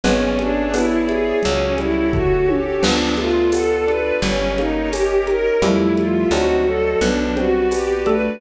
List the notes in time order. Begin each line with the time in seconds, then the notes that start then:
0.04 G#1 G#3 B3 C#4 G#4 B4 C#5 D5 E5, cowbell, low conga
0.39 C#4 D4, high conga
0.74 B3 D4 E4 B4, tambourine, cowbell, high conga
1.07 E4 G#4, high conga
1.43 C#2 F#3 C#4 F#4 G4 A4 C#5, cowbell, low conga
1.78 G3 E4, high conga
2.13 A3 F#4, kick, floor tom
2.48 C#4 G4, high tom
2.82 D2 F3 B3 D4 F4 A4 B4 D5, crash, cowbell, low conga
3.18 A3 F4, high conga
3.52 B3 A4, tambourine, cowbell, high conga
3.86 D4 B4, high conga
4.22 G1 G3 C#4 G4 A#4 C#5 D#5, cowbell, low conga
4.57 A#3 D#4, high conga
4.92 C#4 G4, tambourine, cowbell, high conga
5.27 D#4 A#4, high conga
5.62 F2 F3 G3 A3 E4 F4 G4 A4 E5, cowbell, low conga
5.97 F4, high conga
6.31 D2 F#3 C4 D4 D#4 F#4 C5 D5 D#5, tambourine, cowbell, high conga
6.66 F#3 A4
7.01 B1 B3 D4 F#4 G4 B4 D5, cowbell, low conga
7.37 G3 C4 F#4 C5, high conga
7.71 B3 G4, tambourine, cowbell, high conga
8.06 A3 D4 A4 B4, high conga